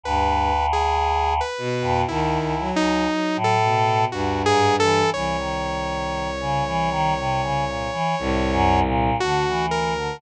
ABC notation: X:1
M:5/4
L:1/16
Q:1/4=59
K:none
V:1 name="Choir Aahs" clef=bass
D,,6 z F,, (3D,,2 ^C,,2 C,,2 z A,,3 (3D,,2 ^G,,2 E,2 | E, ^D,4 ^C, E, D, =C, ^C, ^A,, E, (3=A,,2 ^F,,2 ^A,,2 =D, E,2 D, |]
V:2 name="Violin" clef=bass
G,,2 z4 B,,2 ^D,2 ^F,2 F,2 B,,2 G,,4 | C,,12 C,,4 D,,4 |]
V:3 name="Lead 2 (sawtooth)"
(3B4 ^G4 B4 (3E4 ^D4 A4 (3^F2 G2 A2 | ^c16 ^F2 ^A2 |]